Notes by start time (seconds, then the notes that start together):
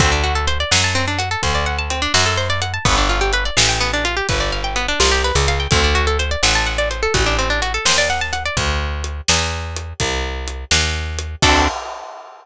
0.00 D2 C4, kick, closed hi-hat
0.12 D4
0.24 F#4
0.35 A4
0.47 C5, closed hi-hat
0.60 D5
0.71 F#2 F#5, snare
0.84 A5
0.95 C4
1.08 D4
1.19 F#4, closed hi-hat
1.31 A4
1.43 D2 C5, kick, closed hi-hat
1.55 D5
1.66 F#5
1.79 A5
1.90 C4, closed hi-hat
2.02 D4
2.14 F#2 F#4, snare
2.26 A4
2.37 C5
2.50 D5
2.62 F#5, closed hi-hat
2.74 A5
2.85 G1 B3, kick, closed hi-hat
2.98 D4
3.09 F4
3.21 G4
3.33 B4, closed hi-hat
3.45 D5
3.57 A1 F5, snare
3.69 G5
3.81 B3
3.93 D4
4.05 F4, closed hi-hat
4.17 G4
4.29 G1 B4, kick, closed hi-hat
4.40 D5
4.52 F5
4.64 G5
4.76 B3, closed hi-hat
4.88 D4
5.00 C2 F4, snare
5.12 G4
5.24 B4
5.35 C#2 D5
5.48 F5, closed hi-hat
5.60 G5
5.71 D2 C4, kick, closed hi-hat
5.84 D4
5.95 F#4
6.07 A4
6.19 C5, closed hi-hat
6.31 D5
6.43 A1 F#5, snare
6.55 A5
6.66 F#5
6.78 D5
6.91 C5, closed hi-hat
7.03 A4
7.14 A1 F#4, kick, closed hi-hat
7.26 D4
7.38 C4
7.50 D4
7.62 F#4, closed hi-hat
7.74 A4
7.85 D#2 C5, snare
7.98 D5
8.10 F#5
8.21 A5
8.33 F#5, closed hi-hat
8.46 D5
8.57 D2, kick, closed hi-hat
9.04 closed hi-hat
9.28 E2, snare
9.76 closed hi-hat
10.00 C2, kick, closed hi-hat
10.48 closed hi-hat
10.71 D#2, snare
11.19 closed hi-hat
11.42 D2 C4 D4 F#4 A4, kick, crash